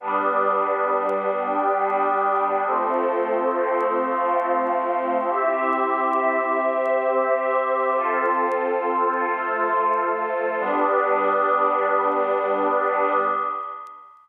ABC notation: X:1
M:3/4
L:1/8
Q:1/4=68
K:Gmix
V:1 name="Pad 5 (bowed)"
[G,B,D]6 | [F,A,C]6 | [CGe]6 | [FAc]6 |
[G,B,D]6 |]
V:2 name="Pad 2 (warm)"
[GBd]3 [Gdg]3 | [FAc]3 [Fcf]3 | [CEG]3 [CGc]3 | [F,CA]3 [F,A,A]3 |
[GBd]6 |]